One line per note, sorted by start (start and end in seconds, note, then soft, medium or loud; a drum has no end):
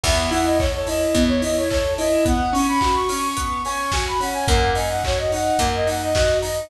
0.03 1.06 E2 loud
0.03 0.28 B3 loud
0.03 0.31 E5 loud
0.03 kick medium
0.03 crash loud
0.31 0.56 E4 medium
0.31 0.46 F#5 loud
0.31 open hi-hat medium
0.44 0.58 D#5 loud
0.59 0.85 A4 medium
0.59 0.72 C#5 loud
0.59 kick medium
0.59 clap medium
0.75 0.88 C#5 loud
0.87 1.12 E4 medium
0.87 1.23 D#5 medium
0.87 open hi-hat medium
1.14 2.17 E2 medium
1.14 1.40 B3 medium
1.14 kick medium
1.14 closed hi-hat medium
1.28 1.41 C#5 loud
1.42 1.67 E4 medium
1.42 1.56 D#5 medium
1.42 open hi-hat medium
1.56 1.69 C#5 loud
1.69 1.96 A4 medium
1.69 1.94 C#5 loud
1.69 kick medium
1.69 clap medium
1.98 2.23 E4 medium
1.98 2.25 D#5 loud
1.98 open hi-hat medium
2.25 2.50 B3 loud
2.25 2.54 F#5 loud
2.25 kick medium
2.25 closed hi-hat medium
2.53 2.78 C#4 loud
2.53 2.66 C#6 loud
2.53 open hi-hat medium
2.68 2.95 B5 loud
2.81 3.07 F#4 medium
2.81 kick medium
2.81 clap medium
2.95 3.08 C#6 loud
3.09 3.34 C#4 medium
3.09 3.21 C#6 loud
3.09 open hi-hat medium
3.22 3.62 C#6 medium
3.37 3.62 B3 medium
3.37 kick medium
3.37 closed hi-hat medium
3.65 3.91 C#4 medium
3.65 3.92 C#6 loud
3.65 open hi-hat medium
3.92 4.18 F#4 medium
3.92 4.05 G#5 loud
3.92 kick medium
3.92 snare loud
4.08 4.21 B5 loud
4.20 4.45 C#4 medium
4.20 4.34 F#5 medium
4.20 open hi-hat medium
4.33 4.47 G#5 loud
4.47 5.50 F#2 loud
4.47 4.73 A#3 loud
4.47 4.71 F#5 loud
4.47 kick loud
4.47 closed hi-hat medium
4.75 5.00 D#4 medium
4.75 4.89 G#5 medium
4.75 open hi-hat medium
4.90 5.03 F#5 loud
5.04 5.30 F#4 medium
5.04 5.19 C#5 loud
5.04 kick medium
5.04 clap loud
5.19 5.32 D#5 medium
5.32 5.57 D#4 medium
5.32 5.69 F#5 loud
5.32 open hi-hat medium
5.59 6.61 F#2 loud
5.59 5.84 A#3 medium
5.59 kick medium
5.59 closed hi-hat medium
5.75 5.88 D#5 loud
5.87 6.12 D#4 medium
5.87 6.02 F#5 loud
5.87 open hi-hat medium
6.03 6.14 D#5 loud
6.14 6.41 F#4 medium
6.14 6.38 D#5 loud
6.14 kick medium
6.14 snare medium
6.42 6.67 D#4 medium
6.42 6.67 D#5 medium
6.42 open hi-hat medium